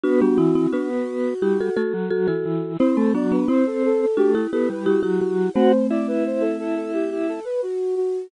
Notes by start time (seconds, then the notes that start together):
0.03 B3 D4 F#4
0.21 G3 B3 D4
0.38 E3 C4 E4
0.55 C4 E4
0.73 B3 D4 F#4
1.42 G3 E4 G4
1.61 F#4 A4
1.77 A3 F#4 A4
1.94 F#3
2.10 F#3 F#4 A4
2.28 E3 F#4 A4
2.45 E3
2.79 C4 E4 C5
2.97 A3 C4
3.14 F#3 B3 D4 D5
3.32 B3 D4 B4
3.48 C4 E4 C5
3.66 A4
3.85 A4
4.01 A4
4.17 A3 D4 F#4 G4
4.35 E4 G4
4.53 B3 E4 G4 A4
4.70 G3 B4
4.86 G3 E4 F#4 G4
5.03 F#3 E4 G4
5.20 F#3 F#4
5.54 A3 C4 F#4 C5
5.90 E4 D5
6.08 B4
6.26 C5
6.40 A4
6.59 A4
6.75 A4
6.93 G4
7.11 G4
7.28 A4
7.45 B4
7.62 F#4
7.96 F#4